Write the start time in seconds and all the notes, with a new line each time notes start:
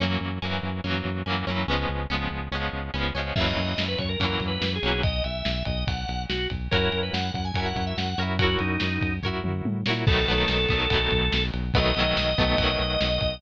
0.00 F#2 F#3 A#3 C#4
0.04 E3
0.21 F#2
0.42 F#2 F#3 A#3 C#4
0.46 E3
0.63 F#2
0.84 F#2 F#3 A#3 C#4
0.88 E3
1.05 F#2
1.26 F#2 F#3 A#3 C#4
1.30 E3
1.47 F#2 F#3 A#3 C#4
1.51 E3
1.68 C#2 G#3 B3 C#4
1.72 F3
1.89 C#2
2.10 C#2 G#3 B3 C#4
2.14 F3
2.31 C#2
2.51 C#2 G#3 B3 C#4
2.56 F3
2.73 C#2
2.94 C#2 G#3 B3 C#4
2.98 F3
3.15 C#2 G#3 B3 C#4
3.19 F3
3.36 F#2 F#3 A#3 C#4 E5, kick, crash
3.40 E3
3.46 D#5
3.57 F#2 D#5, ride
3.78 F#2, snare
3.88 B4
3.99 F#2 C#5, kick, ride
4.09 A#4
4.20 F#2 F#3 A#3 C#4 A#4, kick, ride
4.24 E3
4.40 F#2, kick, ride
4.48 B4
4.61 F#2, snare
4.75 G#4
4.83 B1 F#3 A#3 C#4, ride
4.87 E3
5.03 D#5, kick, ride
5.24 B1 E5, ride
5.45 B1, snare
5.65 B1 D#5, kick, ride
5.87 B1 F#5, kick, ride
6.08 B1, ride
6.29 B1 F#4, snare
6.50 B1, kick, ride
6.71 F#2 F#4 A#4 C#5, kick, ride
6.76 E4
6.92 F#2, ride
7.03 B4
7.13 F#2 F#5, snare
7.34 F#2 F#5, kick, ride
7.45 G#5
7.54 F#2 F#4 A#4 C#5 G#5, kick, ride
7.59 E4
7.66 F#5
7.76 F#2, kick, ride
7.87 E5
7.97 F#2 F#5, snare
8.18 F#2 F#4 A#4 C#5, ride
8.22 E4
8.39 F#4 A#4 C#5, kick, ride
8.44 E4
8.59 F#2 D#4, ride
8.80 F#2, snare
9.01 F#2, kick, ride
9.23 F#2 F#4 A#4 C#5, kick, floor tom
9.27 E4
9.44 F#2, mid tom
9.65 A2, high tom
9.86 A#2 F#4 A#4 C#5, snare
9.90 E4
10.07 B1 F#3 A3 B3 A4, kick, crash
10.12 D#3
10.28 B1 F#3 A3 B3
10.32 D#3
10.48 B1, snare, ride
10.69 B1 A3 B3, kick, ride
10.73 D#3 F#3
10.90 B1 F#3 A3 B3, kick, ride
10.95 D#3
11.11 B1, kick, ride
11.32 B1, snare
11.54 B1, ride
11.74 B1 F#3 A3 B3 D#5, kick, ride
11.79 D#3
11.95 B1 F#3 A3 B3, ride
12.00 D#3
12.17 B1, snare
12.38 B1 F#3 A3 B3, kick, ride
12.42 D#3
12.58 B1 F#3 A3 B3, kick, ride
12.63 D#3
12.80 B1, ride
13.01 B1, snare
13.21 B1, kick, ride